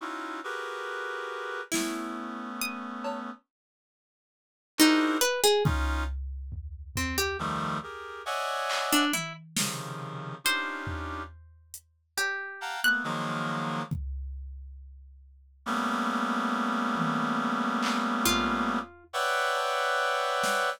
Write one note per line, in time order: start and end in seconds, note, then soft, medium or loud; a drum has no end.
0.01 0.40 C#4 medium
0.01 0.40 D#4 medium
0.01 0.40 E4 medium
0.01 0.40 F4 medium
0.01 0.40 F#4 medium
0.44 1.61 F#4 medium
0.44 1.61 G4 medium
0.44 1.61 G#4 medium
0.44 1.61 A#4 medium
0.44 1.61 B4 medium
1.72 3.30 A3 medium
1.72 3.30 B3 medium
1.72 3.30 C#4 medium
1.72 2.50 E4 medium
1.72 snare medium
2.61 3.40 D#6 loud
3.04 cowbell loud
4.78 5.17 D4 medium
4.78 5.19 D#4 loud
4.78 5.17 E4 medium
4.78 5.17 F#4 medium
4.78 5.17 G#4 medium
4.78 5.17 A#4 medium
4.78 5.17 C5 medium
4.78 clap medium
5.21 5.41 B4 loud
5.44 5.63 G#4 loud
5.64 6.04 C#4 medium
5.64 6.04 D#4 medium
5.64 6.04 F4 medium
5.64 kick loud
6.52 floor tom medium
6.96 7.16 C4 medium
6.96 floor tom medium
7.18 7.37 G4 medium
7.39 7.78 D#3 medium
7.39 7.78 F3 medium
7.39 7.78 G3 medium
7.39 7.78 A3 medium
7.83 8.22 G4 medium
7.83 8.22 G#4 medium
7.83 8.22 A#4 medium
8.26 9.04 C#5 medium
8.26 9.04 D5 medium
8.26 9.04 D#5 medium
8.26 9.04 E5 medium
8.26 9.04 F#5 medium
8.26 9.04 G#5 medium
8.70 clap loud
8.93 9.12 D4 loud
9.13 9.33 E4 medium
9.13 high tom medium
9.57 10.35 C3 medium
9.57 10.35 C#3 medium
9.57 10.35 D#3 medium
9.57 10.35 F3 medium
9.57 snare loud
10.44 11.22 C#4 medium
10.44 11.22 D4 medium
10.44 11.22 D#4 medium
10.44 11.22 F4 medium
10.44 11.22 G4 medium
10.44 12.02 C5 loud
10.87 floor tom medium
11.74 closed hi-hat medium
12.17 12.76 G4 medium
12.17 cowbell medium
12.61 12.80 F5 medium
12.61 12.80 F#5 medium
12.61 12.80 G5 medium
12.61 12.80 A5 medium
12.61 12.80 A#5 medium
12.84 13.03 A3 medium
12.84 13.03 A#3 medium
12.84 13.03 B3 medium
12.84 13.04 F#6 loud
13.04 13.82 D#3 medium
13.04 13.82 F3 medium
13.04 13.82 F#3 medium
13.04 13.82 G#3 medium
13.04 13.82 A#3 medium
13.91 kick medium
15.66 18.79 G3 medium
15.66 18.79 A3 medium
15.66 18.79 A#3 medium
15.66 18.79 B3 medium
15.66 18.79 C#4 medium
16.96 high tom medium
17.83 clap loud
18.26 19.04 F4 loud
18.26 floor tom medium
19.13 20.70 B4 loud
19.13 20.70 C#5 loud
19.13 20.70 D5 loud
19.13 20.70 E5 loud
19.13 20.70 F#5 loud
19.13 20.70 G5 loud
19.57 cowbell medium
20.43 snare medium